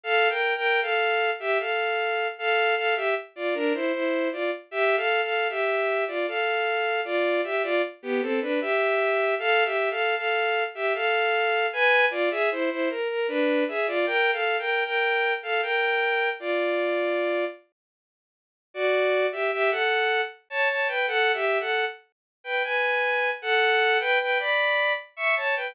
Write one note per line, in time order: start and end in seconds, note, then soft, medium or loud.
0.04 0.28 A4 loud
0.04 0.28 F5 loud
0.29 0.54 A#4 medium
0.29 0.54 G5 loud
0.56 0.80 A#4 loud
0.56 0.80 G5 loud
0.82 1.31 A4 medium
0.82 1.31 F5 loud
1.40 1.58 G4 loud
1.40 1.58 E5 loud
1.60 2.27 A4 medium
1.60 2.27 F5 medium
2.38 2.75 A4 loud
2.38 2.75 F5 loud
2.76 2.95 A4 loud
2.76 2.95 F5 loud
2.96 3.14 G4 medium
2.96 3.14 E5 loud
3.36 3.54 F4 medium
3.36 3.54 D5 medium
3.54 3.73 D4 loud
3.54 3.73 A#4 loud
3.74 3.92 E4 medium
3.74 3.92 C5 loud
3.93 4.29 E4 medium
3.93 4.29 C5 loud
4.32 4.51 F4 medium
4.32 4.51 D5 medium
4.71 4.96 G4 loud
4.71 4.96 E5 loud
4.97 5.21 A4 loud
4.97 5.21 F5 loud
5.23 5.48 A4 medium
5.23 5.48 F5 medium
5.50 6.04 G4 medium
5.50 6.04 E5 loud
6.08 6.26 F4 medium
6.08 6.26 D5 medium
6.27 7.01 A4 medium
6.27 7.01 F5 medium
7.05 7.41 F4 medium
7.05 7.41 D5 loud
7.44 7.63 G4 medium
7.44 7.63 E5 loud
7.63 7.82 F4 loud
7.63 7.82 D5 loud
8.03 8.21 B3 medium
8.03 8.21 G4 loud
8.21 8.40 C4 medium
8.21 8.40 A4 loud
8.41 8.60 D4 medium
8.41 8.60 B4 loud
8.61 9.35 G4 loud
8.61 9.35 E5 loud
9.39 9.64 A4 loud
9.39 9.64 F5 loud
9.65 9.89 G4 medium
9.65 9.89 E5 loud
9.90 10.15 A4 medium
9.90 10.15 F5 loud
10.16 10.64 A4 medium
10.16 10.64 F5 loud
10.75 10.93 G4 medium
10.75 10.93 E5 loud
10.94 11.67 A4 medium
10.94 11.67 F5 loud
11.73 12.06 B4 loud
11.73 12.06 G#5 loud
12.11 12.29 F4 loud
12.11 12.29 D5 loud
12.31 12.49 G#4 loud
12.31 12.49 E5 loud
12.51 12.70 E4 medium
12.51 12.70 C5 loud
12.70 12.89 E4 medium
12.70 12.89 C5 loud
12.90 13.08 A#4 loud
13.09 13.27 A#4 loud
13.28 13.64 D4 loud
13.28 13.64 B4 loud
13.68 13.87 G#4 medium
13.68 13.87 E5 loud
13.87 14.06 F4 loud
13.87 14.06 D5 loud
14.06 14.31 A#4 loud
14.06 14.31 G5 loud
14.32 14.57 A4 medium
14.32 14.57 F5 loud
14.59 14.83 A#4 medium
14.59 14.83 G5 loud
14.85 15.33 A#4 medium
14.85 15.33 G5 loud
15.43 15.61 A4 medium
15.43 15.61 F5 loud
15.62 16.29 A#4 medium
15.62 16.29 G5 loud
16.40 17.45 F4 medium
16.40 17.45 D5 loud
18.74 19.27 F#4 loud
18.74 19.27 D5 loud
19.32 19.51 G4 medium
19.32 19.51 E5 loud
19.52 19.70 G4 loud
19.52 19.70 E5 loud
19.71 20.21 A4 medium
19.71 20.21 F#5 loud
20.50 20.69 C#5 loud
20.50 20.69 A5 loud
20.69 20.88 C#5 medium
20.69 20.88 A5 medium
20.88 21.06 B4 medium
20.88 21.06 G5 loud
21.07 21.32 A4 loud
21.07 21.32 F#5 loud
21.34 21.58 G4 medium
21.34 21.58 E5 loud
21.60 21.85 A4 medium
21.60 21.85 F#5 loud
22.44 22.63 B4 medium
22.44 22.63 G5 medium
22.63 23.30 B4 medium
22.63 23.30 G#5 loud
23.42 23.98 A4 loud
23.42 23.98 F#5 loud
24.00 24.19 B4 loud
24.00 24.19 G5 loud
24.20 24.38 B4 medium
24.20 24.38 G5 loud
24.39 24.93 D5 medium
24.39 24.93 B5 loud
25.17 25.35 E5 loud
25.17 25.35 C#6 loud
25.36 25.55 C#5 medium
25.36 25.55 A5 loud
25.56 25.75 B4 medium
25.56 25.75 G5 loud